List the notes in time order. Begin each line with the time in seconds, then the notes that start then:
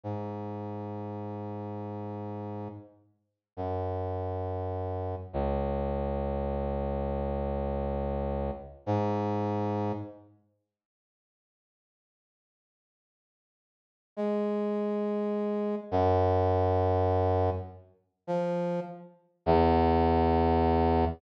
0.04 G#2
3.57 F#2
5.33 C#2
8.86 G#2
14.17 G#3
15.91 F#2
18.27 F3
19.46 E2